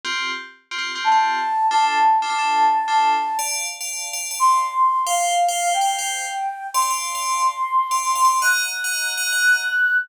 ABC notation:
X:1
M:5/4
L:1/16
Q:1/4=179
K:Ddor
V:1 name="Flute"
z12 a8 | a20 | z12 c'8 | f8 g12 |
c'20 | [K:Ebdor] g'20 |]
V:2 name="Tubular Bells"
[CFG]8 [CFG] [CFG]2 [CFG]2 [CFG]7 | [DFA]6 [DFA] [DFA] [DFA]6 [DFA]6 | [dfa]5 [dfa]4 [dfa]2 [dfa]9 | [cfg]5 [cfg]4 [cfg]2 [cfg]9 |
[dfa] [dfa] [dfa]3 [dfa]9 [dfa]3 [dfa] [dfa]2 | [K:Ebdor] [egb]5 [egb]4 [egb]2 [egb]9 |]